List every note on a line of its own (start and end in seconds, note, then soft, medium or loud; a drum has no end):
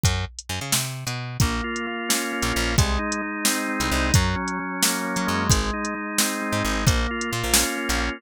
0.04 0.25 F#2 medium
0.04 kick medium
0.04 closed hi-hat medium
0.39 closed hi-hat medium
0.49 0.60 F#2 medium
0.61 0.72 C#3 medium
0.72 1.04 C3 medium
0.72 snare loud
1.07 1.37 B2 medium
1.07 closed hi-hat medium
1.40 1.61 A#1 medium
1.40 1.86 A#3 medium
1.40 kick loud
1.40 closed hi-hat medium
1.64 2.52 F4 medium
1.76 closed hi-hat medium
1.87 2.32 A#3 medium
2.09 2.73 C#4 medium
2.09 snare loud
2.32 2.76 A#3 medium
2.42 2.53 A#1 medium
2.42 closed hi-hat medium
2.53 2.77 A#1 medium
2.53 2.75 F4 medium
2.78 2.98 C2 medium
2.78 3.21 G#3 medium
2.78 kick loud
2.78 closed hi-hat medium
2.99 3.92 D#4 medium
3.12 closed hi-hat medium
3.22 3.68 G#3 medium
3.45 4.10 C4 medium
3.45 snare loud
3.68 4.11 G#3 medium
3.80 3.90 C2 medium
3.80 closed hi-hat medium
3.91 4.12 C2 medium
3.91 4.14 D#4 medium
4.14 4.35 F#2 loud
4.14 4.59 F#3 medium
4.14 kick loud
4.14 closed hi-hat loud
4.36 5.44 C#4 medium
4.48 closed hi-hat medium
4.59 5.04 F#3 medium
4.82 5.47 A#3 medium
4.82 snare loud
5.04 5.47 F#3 medium
5.16 5.27 F#3 medium
5.16 closed hi-hat medium
5.27 5.49 F#2 medium
5.27 5.94 G#3 medium
5.49 5.71 G#1 medium
5.49 kick loud
5.49 closed hi-hat loud
5.73 6.64 D#4 medium
5.85 closed hi-hat medium
5.95 6.41 G#3 medium
6.18 6.83 C4 medium
6.18 snare loud
6.42 6.85 G#3 medium
6.52 6.63 G#2 medium
6.64 6.85 G#1 medium
6.64 6.86 D#4 medium
6.86 7.07 A#1 medium
6.86 7.31 A#3 medium
6.86 kick loud
6.86 closed hi-hat medium
7.11 8.00 F4 medium
7.21 closed hi-hat medium
7.31 7.43 A#2 medium
7.31 7.77 A#3 medium
7.43 7.64 A#1 medium
7.53 8.18 C#4 medium
7.53 snare loud
7.77 8.21 A#3 medium
7.89 8.10 A#1 medium
7.89 closed hi-hat medium
8.00 8.22 F4 medium